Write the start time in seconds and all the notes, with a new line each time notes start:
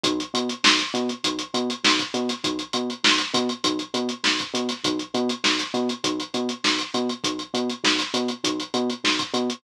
0.04 B1, kick, closed hi-hat
0.20 closed hi-hat
0.34 B2, closed hi-hat
0.49 closed hi-hat
0.64 B1, snare
0.79 snare, closed hi-hat
0.94 B2, closed hi-hat
1.09 closed hi-hat
1.24 B1, kick, closed hi-hat
1.39 closed hi-hat
1.54 B2, closed hi-hat
1.70 closed hi-hat
1.84 B1, snare
1.99 kick, closed hi-hat
2.14 B2, closed hi-hat
2.29 snare, closed hi-hat
2.44 B1, kick, closed hi-hat
2.59 closed hi-hat
2.73 B2, closed hi-hat
2.90 closed hi-hat
3.04 B1, snare
3.18 snare, closed hi-hat
3.34 B2, kick, closed hi-hat
3.49 closed hi-hat
3.64 B1, kick, closed hi-hat
3.79 closed hi-hat
3.94 B2, closed hi-hat
4.09 closed hi-hat
4.24 B1, snare
4.39 kick, closed hi-hat
4.54 B2, closed hi-hat
4.69 snare, closed hi-hat
4.84 B1, kick, closed hi-hat
4.99 closed hi-hat
5.14 B2, closed hi-hat
5.29 closed hi-hat
5.44 B1, snare
5.59 snare, closed hi-hat
5.74 B2, closed hi-hat
5.89 closed hi-hat
6.04 B1, kick, closed hi-hat
6.20 closed hi-hat
6.34 B2, closed hi-hat
6.49 closed hi-hat
6.64 B1, snare
6.79 closed hi-hat
6.94 B2, closed hi-hat
7.09 closed hi-hat
7.24 B1, kick, closed hi-hat
7.39 closed hi-hat
7.54 B2, closed hi-hat
7.70 closed hi-hat
7.84 B1, snare
7.99 snare, closed hi-hat
8.14 B2, closed hi-hat
8.28 closed hi-hat
8.44 B1, kick, closed hi-hat
8.60 closed hi-hat
8.74 B2, closed hi-hat
8.90 closed hi-hat
9.04 B1, snare
9.19 kick, closed hi-hat
9.34 B2, closed hi-hat
9.50 closed hi-hat